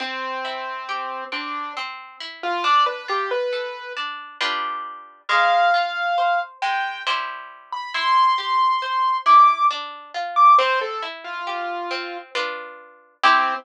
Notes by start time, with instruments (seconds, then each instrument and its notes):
0.00 orchestral harp C4, acoustic grand piano C4
0.45 orchestral harp E4
0.89 orchestral harp G4
1.32 orchestral harp C4, acoustic grand piano D4
1.77 orchestral harp C4
2.20 orchestral harp E4
2.43 acoustic grand piano F4
2.64 orchestral harp D4, acoustic grand piano D5
2.86 acoustic grand piano B4
3.08 orchestral harp F4, acoustic grand piano G4
3.31 acoustic grand piano B4
3.53 orchestral harp A4
3.97 orchestral harp D4
4.41 orchestral harp G3 D4 F4 B4
5.29 orchestral harp G#3, acoustic grand piano F5
5.74 orchestral harp F4
6.18 orchestral harp C5
6.62 orchestral harp G#3, acoustic grand piano G5
7.07 orchestral harp G3 E4 C5
7.72 acoustic grand piano B5
7.94 orchestral harp E4, acoustic grand piano C6
8.38 orchestral harp G4
8.82 orchestral harp C5
9.26 orchestral harp E4, acoustic grand piano D6
9.71 orchestral harp D4
10.14 orchestral harp F4
10.36 acoustic grand piano D6
10.58 orchestral harp C4, acoustic grand piano C5
10.81 acoustic grand piano A4
11.03 orchestral harp E4
11.24 acoustic grand piano F4
11.47 orchestral harp G4
11.91 orchestral harp C4
12.35 orchestral harp D4 F4 B4
13.24 acoustic grand piano C4, orchestral harp C4 E4 G4